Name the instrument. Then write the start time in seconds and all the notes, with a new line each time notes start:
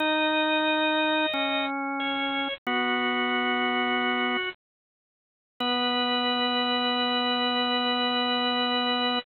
drawbar organ
0.00 D#4 D#5
1.33 C#4
2.00 C#5
2.67 B3 F#4
5.60 B3 B4